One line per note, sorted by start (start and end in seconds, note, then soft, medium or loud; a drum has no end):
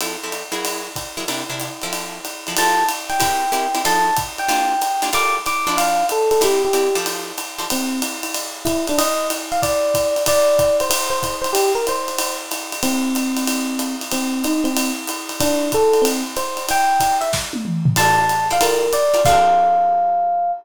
0.01 0.16 F3 medium
0.01 0.16 C4 medium
0.01 0.16 E4 medium
0.01 0.16 A4 medium
0.01 ride loud
0.23 0.43 F3 medium
0.23 0.43 C4 medium
0.23 0.43 E4 medium
0.23 0.43 A4 medium
0.32 hi-hat pedal medium
0.32 ride medium
0.52 0.88 F#3 medium
0.52 0.88 E4 loud
0.52 0.88 G#4 loud
0.52 0.88 A#4 medium
0.52 ride medium
0.65 ride loud
0.96 kick medium
0.96 hi-hat pedal medium
0.96 ride medium
1.17 1.25 F#3 medium
1.17 1.25 E4 medium
1.17 1.25 G#4 medium
1.17 1.25 A#4 medium
1.17 ride medium
1.28 1.43 C3 medium
1.28 1.43 D4 medium
1.28 1.43 E4 medium
1.28 1.43 A#4 medium
1.28 ride loud
1.50 1.69 C3 medium
1.50 1.69 D4 medium
1.50 1.69 E4 medium
1.50 1.69 A#4 medium
1.60 hi-hat pedal loud
1.60 ride medium
1.82 2.19 F3 loud
1.82 2.19 C4 loud
1.82 2.19 E4 medium
1.82 2.19 A4 medium
1.82 ride medium
1.93 ride loud
2.25 hi-hat pedal medium
2.25 ride medium
2.47 2.55 F3 medium
2.47 2.55 C4 medium
2.47 2.55 E4 medium
2.47 2.55 A4 medium
2.47 ride medium
2.57 2.84 F3 loud
2.57 2.84 C4 loud
2.57 2.84 G4 medium
2.57 2.84 A4 loud
2.57 2.86 A5 medium
2.57 ride loud
2.89 hi-hat pedal medium
2.89 ride loud
3.10 3.79 G5 medium
3.10 ride medium
3.20 3.45 C4 loud
3.20 3.45 E4 medium
3.20 3.45 G4 loud
3.20 3.45 A#4 medium
3.20 kick medium
3.20 ride loud
3.52 3.67 C4 medium
3.52 3.67 E4 loud
3.52 3.67 G4 medium
3.52 3.67 A#4 medium
3.52 hi-hat pedal loud
3.52 ride medium
3.75 3.82 C4 medium
3.75 3.82 E4 medium
3.75 3.82 G4 loud
3.75 3.82 A#4 medium
3.75 ride medium
3.85 4.10 F3 loud
3.85 4.10 D#4 loud
3.85 4.10 A4 loud
3.85 4.10 C5 loud
3.85 4.16 A5 medium
3.85 ride loud
4.16 kick medium
4.16 hi-hat pedal loud
4.16 ride loud
4.38 5.05 G5 medium
4.38 ride medium
4.48 4.74 A#3 loud
4.48 4.74 D4 loud
4.48 4.74 F4 loud
4.48 4.74 G4 loud
4.48 ride loud
4.81 hi-hat pedal loud
4.81 ride loud
5.02 5.10 A#3 medium
5.02 5.10 D4 medium
5.02 5.10 F4 loud
5.02 5.10 G4 medium
5.02 ride loud
5.13 5.38 G3 loud
5.13 5.38 F4 loud
5.13 5.38 A4 loud
5.13 5.38 A#4 loud
5.13 5.35 D6 medium
5.13 ride loud
5.46 5.77 D6 medium
5.46 hi-hat pedal medium
5.46 ride loud
5.67 6.03 F3 medium
5.67 6.03 D4 loud
5.67 6.03 E4 loud
5.67 6.03 C5 loud
5.67 ride medium
5.77 6.06 F5 medium
5.77 ride loud
6.09 6.29 A4 medium
6.09 hi-hat pedal medium
6.09 ride medium
6.31 6.41 A4 medium
6.31 ride medium
6.41 6.67 C4 medium
6.41 6.67 E4 loud
6.41 6.67 G4 loud
6.41 6.62 G4 medium
6.41 6.67 A#4 loud
6.41 ride loud
6.65 6.95 G4 medium
6.73 6.88 C4 loud
6.73 6.88 E4 loud
6.73 6.88 G4 medium
6.73 6.88 A#4 medium
6.73 hi-hat pedal medium
6.73 ride loud
6.95 7.32 F3 loud
6.95 7.32 G4 loud
6.95 7.32 A4 loud
6.95 7.32 C5 loud
6.95 ride medium
7.06 ride loud
7.38 hi-hat pedal medium
7.38 ride medium
7.58 7.66 F3 medium
7.58 7.66 G4 medium
7.58 7.66 A4 medium
7.58 7.66 C5 loud
7.58 ride medium
7.70 8.01 C4 medium
7.70 ride loud
8.02 hi-hat pedal medium
8.02 ride loud
8.23 ride loud
8.34 ride loud
8.65 8.85 E4 medium
8.65 kick medium
8.65 hi-hat pedal loud
8.65 ride loud
8.87 8.99 D4 medium
8.87 ride medium
8.98 9.28 D#5 medium
8.98 ride loud
9.30 hi-hat pedal loud
9.30 ride loud
9.52 9.60 F5 medium
9.52 ride medium
9.62 10.23 D5 medium
9.62 kick medium
9.62 ride loud
9.94 kick medium
9.94 hi-hat pedal medium
9.94 ride loud
10.16 ride medium
10.26 10.77 D5 medium
10.26 kick medium
10.26 ride loud
10.59 kick medium
10.59 hi-hat pedal loud
10.59 ride medium
10.80 10.89 C5 medium
10.80 ride medium
10.90 11.09 C5 medium
10.90 ride loud
11.10 11.36 C5 medium
11.23 kick medium
11.23 hi-hat pedal medium
11.23 ride loud
11.42 11.51 C5 medium
11.42 ride medium
11.53 11.71 G4 medium
11.53 ride loud
11.75 11.85 A#4 medium
11.87 12.36 C5 medium
11.87 hi-hat pedal medium
11.87 ride loud
12.08 ride medium
12.19 ride loud
12.51 hi-hat pedal medium
12.51 ride loud
12.72 ride loud
12.83 13.94 C4 medium
12.83 ride loud
13.15 hi-hat pedal medium
13.15 ride loud
13.37 ride loud
13.47 ride loud
13.79 hi-hat pedal loud
13.79 ride loud
14.01 ride medium
14.11 14.43 C4 medium
14.11 ride loud
14.44 14.65 D#4 medium
14.44 hi-hat pedal medium
14.44 ride loud
14.64 14.91 C4 medium
14.64 ride medium
14.77 ride loud
15.07 hi-hat pedal loud
15.07 ride loud
15.29 ride medium
15.40 15.69 D4 medium
15.40 kick medium
15.40 ride loud
15.72 16.04 A4 medium
15.72 kick medium
15.72 hi-hat pedal loud
15.72 ride medium
15.93 ride medium
16.02 16.22 C4 medium
16.02 ride loud
16.36 16.67 C5 medium
16.36 hi-hat pedal medium
16.36 ride loud
16.57 ride medium
16.69 17.16 G5 medium
16.69 ride loud
17.00 kick medium
17.00 hi-hat pedal loud
17.00 ride loud
17.21 17.30 E5 medium
17.21 ride medium
17.33 kick medium
17.33 snare loud
17.53 high tom loud
17.65 mid tom loud
17.85 floor tom loud
17.96 18.23 F4 loud
17.96 18.23 A4 loud
17.96 18.23 C5 loud
17.96 18.23 D5 loud
17.96 18.16 A5 loud
17.96 crash loud
17.96 ride loud
18.18 18.47 A5 medium
18.29 hi-hat pedal medium
18.29 ride medium
18.50 18.58 F4 medium
18.50 18.58 A4 medium
18.50 18.58 C5 medium
18.50 18.58 D5 medium
18.50 18.62 F5 medium
18.50 ride medium
18.61 18.86 G3 medium
18.61 18.86 F4 loud
18.61 18.86 A4 loud
18.61 18.86 A#4 loud
18.61 18.93 A#4 medium
18.61 ride loud
18.93 19.22 D5 medium
18.93 hi-hat pedal loud
18.93 ride loud
19.14 19.21 G3 medium
19.14 19.21 F4 medium
19.14 19.21 A4 medium
19.14 19.21 A#4 loud
19.14 ride medium
19.25 20.52 F3 loud
19.25 20.52 C4 medium
19.25 20.52 D4 medium
19.25 20.52 A4 medium
19.25 20.51 F5 loud
19.25 kick loud
19.25 crash loud